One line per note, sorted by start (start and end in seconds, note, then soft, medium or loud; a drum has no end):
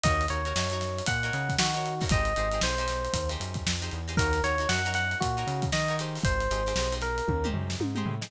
0.04 0.27 D#2 medium
0.04 0.26 D#4 medium
0.04 0.26 F#4 medium
0.04 0.26 A#4 medium
0.04 0.26 C#5 loud
0.04 0.26 D#5 medium
0.04 kick medium
0.04 closed hi-hat medium
0.21 closed hi-hat medium
0.28 0.53 D#2 medium
0.28 0.42 D#4 medium
0.28 0.42 F#4 medium
0.28 0.42 A#4 medium
0.28 1.04 C#5 medium
0.28 0.42 C#5 medium
0.28 closed hi-hat medium
0.45 0.54 D#4 medium
0.45 0.54 F#4 medium
0.45 0.54 A#4 medium
0.45 0.54 C#5 medium
0.45 closed hi-hat soft
0.56 1.02 F#2 medium
0.56 0.68 D#4 medium
0.56 0.68 F#4 medium
0.56 0.68 A#4 medium
0.56 0.68 C#5 medium
0.56 snare medium
0.70 1.11 D#4 medium
0.70 1.11 F#4 medium
0.70 1.11 A#4 medium
0.70 1.11 C#5 medium
0.70 closed hi-hat medium
0.81 snare soft
0.81 closed hi-hat medium
0.98 closed hi-hat medium
1.06 1.31 A#2 medium
1.06 1.54 F#5 medium
1.06 kick medium
1.06 closed hi-hat medium
1.23 1.62 D#4 medium
1.23 1.62 F#4 medium
1.23 1.62 A#4 medium
1.23 1.62 C#5 medium
1.23 closed hi-hat soft
1.33 1.56 C#3 medium
1.33 closed hi-hat medium
1.49 kick medium
1.49 closed hi-hat medium
1.59 2.04 D#3 medium
1.59 2.04 F#4 medium
1.59 snare loud
1.74 1.95 D#4 medium
1.74 1.95 F#4 medium
1.74 1.95 A#4 medium
1.74 1.95 C#5 medium
1.74 closed hi-hat medium
1.86 closed hi-hat medium
2.00 2.09 D#4 medium
2.00 2.09 F#4 medium
2.00 2.09 A#4 medium
2.00 2.09 C#5 medium
2.00 kick medium
2.00 snare soft
2.00 open hi-hat soft
2.09 2.33 G#1 medium
2.09 2.33 D#4 medium
2.09 2.33 G4 medium
2.09 2.33 G#4 medium
2.09 2.33 C5 medium
2.09 2.60 D#5 medium
2.09 kick medium
2.09 closed hi-hat medium
2.25 closed hi-hat medium
2.36 2.60 G#1 medium
2.36 2.49 D#4 medium
2.36 2.49 G4 medium
2.36 2.49 G#4 medium
2.36 2.49 C5 medium
2.36 closed hi-hat medium
2.52 2.61 D#4 medium
2.52 2.61 G4 medium
2.52 2.61 G#4 medium
2.52 2.61 C5 medium
2.52 closed hi-hat medium
2.61 3.08 B1 medium
2.61 2.75 D#4 medium
2.61 2.75 G4 medium
2.61 2.75 G#4 medium
2.61 3.30 C5 medium
2.61 2.75 C5 medium
2.61 snare medium
2.78 3.18 D#4 medium
2.78 3.18 G4 medium
2.78 3.18 G#4 medium
2.78 3.18 C5 medium
2.78 closed hi-hat medium
2.88 snare soft
2.88 closed hi-hat medium
3.05 closed hi-hat soft
3.13 3.37 D#2 medium
3.13 kick medium
3.13 closed hi-hat medium
3.29 3.69 D#4 medium
3.29 3.69 G4 medium
3.29 3.69 G#4 medium
3.29 3.69 C5 medium
3.29 snare soft
3.29 closed hi-hat medium
3.40 3.63 F#2 medium
3.40 closed hi-hat medium
3.54 kick medium
3.54 closed hi-hat medium
3.66 3.90 F2 medium
3.66 snare medium
3.82 4.01 D#4 medium
3.82 4.01 G4 medium
3.82 4.01 G#4 medium
3.82 4.01 C5 medium
3.82 closed hi-hat medium
3.91 4.17 E2 medium
3.91 closed hi-hat soft
4.08 4.16 D#4 medium
4.08 4.16 G4 medium
4.08 4.16 G#4 medium
4.08 4.16 C5 medium
4.08 closed hi-hat soft
4.17 4.41 D#2 medium
4.17 4.40 D#4 loud
4.17 4.40 F#4 loud
4.17 4.42 A#4 medium
4.17 4.40 A#4 medium
4.17 4.40 C#5 medium
4.17 kick medium
4.17 closed hi-hat medium
4.33 snare soft
4.33 closed hi-hat medium
4.43 4.66 D#2 medium
4.43 4.56 D#4 medium
4.43 4.56 F#4 medium
4.43 4.56 A#4 medium
4.43 4.68 C#5 medium
4.43 4.56 C#5 medium
4.43 snare soft
4.43 closed hi-hat medium
4.58 4.68 D#4 medium
4.58 4.68 F#4 medium
4.58 4.68 A#4 medium
4.58 4.68 C#5 medium
4.58 closed hi-hat soft
4.69 5.15 F#2 medium
4.69 4.82 D#4 medium
4.69 4.82 F#4 medium
4.69 4.82 A#4 medium
4.69 4.82 C#5 medium
4.69 4.91 F#5 medium
4.69 snare medium
4.85 5.24 D#4 medium
4.85 5.24 F#4 medium
4.85 5.24 A#4 medium
4.85 5.24 C#5 medium
4.85 snare soft
4.85 closed hi-hat medium
4.94 5.17 F#5 medium
4.94 snare soft
4.94 closed hi-hat medium
5.11 closed hi-hat soft
5.20 5.44 A#2 medium
5.20 5.64 F#4 medium
5.20 kick medium
5.20 closed hi-hat medium
5.37 5.76 D#4 medium
5.37 5.76 F#4 medium
5.37 5.76 A#4 medium
5.37 5.76 C#5 medium
5.37 closed hi-hat soft
5.47 5.70 C#3 medium
5.47 snare soft
5.47 closed hi-hat medium
5.62 kick medium
5.62 closed hi-hat medium
5.72 6.18 D#3 medium
5.72 5.96 D#5 medium
5.72 snare medium
5.88 5.98 D#4 medium
5.88 5.98 F#4 medium
5.88 5.98 A#4 medium
5.88 5.98 C#5 medium
5.88 closed hi-hat soft
5.99 6.47 D#4 medium
5.99 6.47 G4 medium
5.99 6.47 G#4 loud
5.99 6.47 C5 medium
5.99 snare soft
5.99 closed hi-hat medium
6.15 open hi-hat soft
6.24 6.48 G#1 medium
6.24 6.94 C5 medium
6.24 kick medium
6.24 closed hi-hat medium
6.41 closed hi-hat medium
6.51 6.73 G#1 medium
6.51 6.63 D#4 medium
6.51 6.63 G4 medium
6.51 6.63 G#4 medium
6.51 6.63 C5 medium
6.51 closed hi-hat medium
6.66 6.74 D#4 medium
6.66 6.74 G4 medium
6.66 6.74 G#4 medium
6.66 6.74 C5 medium
6.66 closed hi-hat medium
6.76 7.21 B1 medium
6.76 6.89 D#4 medium
6.76 6.89 G4 medium
6.76 6.89 G#4 medium
6.76 6.89 C5 medium
6.76 snare medium
6.92 7.31 D#4 medium
6.92 7.31 G4 medium
6.92 7.31 G#4 medium
6.92 7.31 C5 medium
6.92 closed hi-hat medium
7.01 7.47 A#4 medium
7.01 snare soft
7.01 closed hi-hat medium
7.18 closed hi-hat medium
7.28 7.51 D#2 medium
7.28 kick medium
7.28 high tom medium
7.44 7.83 D#4 medium
7.44 7.83 G4 medium
7.44 7.83 G#4 medium
7.44 7.83 C5 medium
7.44 mid tom medium
7.53 7.76 F#2 medium
7.53 floor tom medium
7.70 snare medium
7.80 8.04 G#2 medium
7.80 high tom medium
7.95 8.15 D#4 medium
7.95 8.15 G4 medium
7.95 8.15 G#4 medium
7.95 8.15 C5 medium
7.95 mid tom medium
8.06 8.29 A2 medium
8.06 floor tom medium
8.21 8.30 D#4 medium
8.21 8.30 G4 medium
8.21 8.30 G#4 medium
8.21 8.30 C5 medium
8.21 snare medium